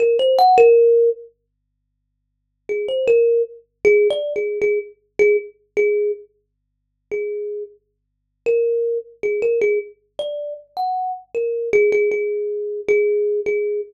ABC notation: X:1
M:6/4
L:1/16
Q:1/4=78
K:none
V:1 name="Kalimba"
^A c ^f A3 z8 ^G c A2 z2 (3G2 d2 G2 | ^G z2 G z2 G2 z5 G3 z4 ^A3 z | ^G ^A G z2 d2 z ^f2 z A2 G G G4 G3 G2 |]